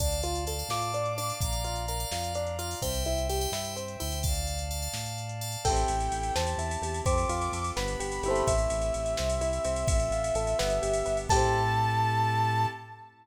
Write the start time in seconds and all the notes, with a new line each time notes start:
0.00 D2 D4 D5 F5 A5, kick, closed hi-hat
0.12 closed hi-hat
0.23 F4, closed hi-hat
0.35 closed hi-hat
0.47 A4 D5 F5 A5, closed hi-hat
0.59 D5 F5 A5, closed hi-hat
0.69 A2 F4 D6, snare
0.82 closed hi-hat
0.94 D4, closed hi-hat
1.06 closed hi-hat
1.18 D4 D5 F5 A5, closed hi-hat
1.30 closed hi-hat
1.41 A#1 D5 F5 A#5, kick, closed hi-hat
1.53 closed hi-hat
1.64 F4, closed hi-hat
1.76 closed hi-hat
1.88 A#4 D5 F5 A#5, closed hi-hat
2.00 D5 F5 A#5, closed hi-hat
2.11 F2 F4, snare
2.24 closed hi-hat
2.35 D4, closed hi-hat
2.47 closed hi-hat
2.59 F4 D5 F5 A#5, closed hi-hat
2.71 open hi-hat
2.82 C2 C4 C5 E5 G5, kick, closed hi-hat
2.94 closed hi-hat
3.05 E4, closed hi-hat
3.18 closed hi-hat
3.29 G4 C5 E5 G5, closed hi-hat
3.41 C5 E5 G5, closed hi-hat
3.52 G2 E4, snare
3.65 closed hi-hat
3.76 C4, closed hi-hat
3.88 closed hi-hat
4.00 D2 E4 C5 E5 G5, closed hi-hat
4.12 closed hi-hat
4.23 D5 F5 A5, kick, closed hi-hat
4.35 closed hi-hat
4.47 closed hi-hat
4.59 closed hi-hat
4.71 D5 F5 A5, closed hi-hat
4.82 D5 F5 A5, closed hi-hat
4.93 A2, snare
5.06 closed hi-hat
5.18 closed hi-hat
5.29 closed hi-hat
5.41 D5 F5 A5, closed hi-hat
5.52 closed hi-hat
5.64 A1 C4 E4 G4 A4 G5, kick, crash
5.69 C4 E4
5.76 ride
5.88 A1, ride
6.00 ride
6.11 A1, ride
6.23 ride
6.35 E2 C4 E4 G4 A5, snare
6.47 ride
6.57 E2 E4, ride
6.71 ride
6.82 E2 G4, ride
6.94 ride
7.05 F2 C4 F4 A4 D6, kick, ride
7.18 ride
7.29 F2 F4, ride
7.41 ride
7.52 F2 A4, ride
7.64 ride
7.76 G1 B3 D4 G4 B5, snare
7.88 ride
8.00 G1 G4, ride
8.12 ride
8.23 G1 E4 G4, ride
8.28 A3 C4
8.35 ride
8.47 A1 A3 C4 E4 G4 E5, kick, ride
8.58 ride
8.70 A1, ride
8.81 ride
8.94 A1, ride
9.06 ride
9.17 C2 C4 E4 G4, snare
9.30 ride
9.39 C2 E4, ride
9.53 ride
9.65 C2 C4, ride
9.76 ride
9.88 A1 C4 F4 A4 E5, kick, ride
10.00 ride
10.11 A1 F4, ride
10.24 ride
10.34 A1 A4, ride
10.47 ride
10.59 G1 B3 D4 G4, snare
10.70 ride
10.82 G1 G4, ride
10.93 ride
11.05 G1 B3, ride
11.17 ride
11.29 A2 C4 E4 G4 A4 A5, kick, crash
11.34 C4 E4